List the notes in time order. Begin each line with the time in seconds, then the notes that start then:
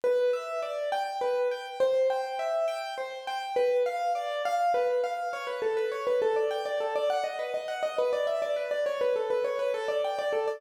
0.04 B4
0.33 E5
0.62 D5
0.92 G5
1.21 B4
1.51 G5
1.80 C5
2.10 G5
2.39 E5
2.68 G5
2.98 C5
3.27 G5
3.56 B4
3.86 F5
4.15 D5
4.45 F5
4.74 B4
5.04 F5
5.33 C#5
5.47 B4
5.62 A4
5.77 B4
5.92 C#5
6.07 B4
6.22 A4
6.36 D5
6.51 G5
6.66 D5
6.80 A4
6.96 D5
7.10 F#5
7.24 D#5
7.39 B4
7.54 D#5
7.68 F#5
7.83 D#5
7.98 B4
8.13 D5
8.27 E5
8.42 D5
8.56 B4
8.71 D5
8.86 C#5
9.01 B4
9.16 A4
9.30 B4
9.44 C#5
9.59 B4
9.74 A4
9.88 D5
10.05 G5
10.19 D5
10.33 A4
10.48 D5